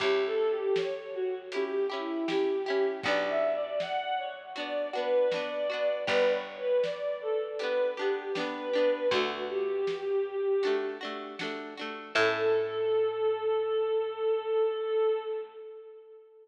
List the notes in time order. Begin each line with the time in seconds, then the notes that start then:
0.00 C#2 C#4 E4 G4, kick, closed hi-hat
0.26 A4
0.50 G4
0.76 C#5, snare
1.14 F#4
1.52 E4 G4, closed hi-hat
1.56 C#4
1.90 C#4 E4 G4
2.28 C#4 E4 G4, snare
2.66 C#4 E4 G4
3.03 B1 D4 F#4 D5, kick, closed hi-hat
3.08 B3
3.29 E5
3.54 D5
3.80 F#5, snare
4.18 C#5
4.56 B3 D4 F#4 D5, closed hi-hat
4.93 B3 D4 F#4 B4
5.31 D4 F#4 D5, snare
5.36 B3
5.70 B3 D4 F#4
6.07 G1 B3 D4 G4 B4, kick, closed hi-hat
6.34 C#5
6.58 B4
6.83 D5, snare
7.21 A4
7.59 D4 G4 B4, closed hi-hat
7.63 B3
7.97 B3 D4 G4
8.35 B3 D4 G4 B4, snare
8.73 B3 D4 G4
9.11 D2 D4 F#4, kick, closed hi-hat
9.16 A3
9.49 G4
9.87 snare
10.63 A3 D4 F#4, closed hi-hat
11.01 A3 D4 F#4
11.39 A3 D4 F#4, snare
11.77 A3 D4 F#4
12.15 A2 C#4 E4 A4, kick, crash